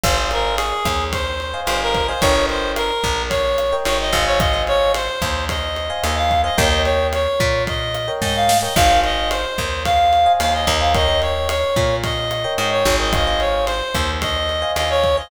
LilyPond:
<<
  \new Staff \with { instrumentName = "Clarinet" } { \time 4/4 \key aes \major \tempo 4 = 110 c''8 bes'8 aes'4 c''4 c''16 bes'8 c''16 | des''8 c''8 bes'4 des''4 des''16 ees''8 des''16 | ees''8 des''8 c''4 ees''4 ees''16 f''8 ees''16 | ees''8 des''8 des''4 ees''4 ees''16 f''8 ees''16 |
f''8 ees''8 c''4 f''4 f''16 ees''8 f''16 | ees''8 des''8 des''4 ees''4 ees''16 des''8 ees''16 | ees''8 des''8 c''4 ees''4 ees''16 des''8 ees''16 | }
  \new Staff \with { instrumentName = "Electric Piano 1" } { \time 4/4 \key aes \major <c'' ees'' f'' aes''>16 <c'' ees'' f'' aes''>2~ <c'' ees'' f'' aes''>8 <c'' ees'' f'' aes''>4 <c'' ees'' f'' aes''>16 | <bes' des'' ees'' g''>16 <bes' des'' ees'' g''>2~ <bes' des'' ees'' g''>8 <bes' des'' ees'' g''>8. <c'' ees'' f'' aes''>8~ | <c'' ees'' f'' aes''>16 <c'' ees'' f'' aes''>2~ <c'' ees'' f'' aes''>8 <c'' ees'' f'' aes''>4 <c'' ees'' f'' aes''>16 | <bes' des'' ees'' g''>16 <bes' des'' ees'' g''>2~ <bes' des'' ees'' g''>8 <bes' des'' ees'' g''>4 <bes' des'' ees'' g''>16 |
<c'' ees'' f'' aes''>16 <c'' ees'' f'' aes''>2~ <c'' ees'' f'' aes''>8 <c'' ees'' f'' aes''>4 <c'' ees'' f'' aes''>16 | <bes' des'' ees'' g''>16 <bes' des'' ees'' g''>2~ <bes' des'' ees'' g''>8 <bes' des'' ees'' g''>4 <bes' des'' ees'' g''>16 | <c'' ees'' f'' aes''>16 <c'' ees'' f'' aes''>2~ <c'' ees'' f'' aes''>8 <c'' ees'' f'' aes''>4 <c'' ees'' f'' aes''>16 | }
  \new Staff \with { instrumentName = "Electric Bass (finger)" } { \clef bass \time 4/4 \key aes \major aes,,4. ees,4. g,,4 | g,,4. bes,,4. aes,,8 aes,,8~ | aes,,4. ees,4. ees,4 | ees,4. bes,4. aes,4 |
aes,,4. ees,4. ees,8 ees,8~ | ees,4. bes,4. aes,8 aes,,8~ | aes,,4. ees,4. ees,4 | }
  \new DrumStaff \with { instrumentName = "Drums" } \drummode { \time 4/4 <cymc bd ss>8 cymr8 cymr8 <bd cymr ss>8 <bd cymr>8 cymr8 <cymr ss>8 <bd cymr>8 | <bd cymr>8 cymr8 <cymr ss>8 <bd cymr>8 <bd cymr>8 <cymr ss>8 cymr8 <bd cymr>8 | <bd cymr ss>8 cymr8 cymr8 <bd cymr ss>8 <bd cymr>8 cymr8 <cymr ss>8 <bd cymr>8 | <bd cymr>8 cymr8 <cymr ss>8 <bd cymr>8 <bd cymr>8 <cymr ss>8 <bd sn>8 sn8 |
<cymc bd ss>8 cymr8 cymr8 <bd cymr ss>8 <bd cymr>8 cymr8 <cymr ss>8 <bd cymr>8 | <bd cymr>8 cymr8 <cymr ss>8 <bd cymr>8 <bd cymr>8 <cymr ss>8 cymr8 <bd cymr>8 | <bd cymr ss>8 cymr8 cymr8 <bd cymr ss>8 <bd cymr>8 cymr8 <cymr ss>8 <bd cymr>8 | }
>>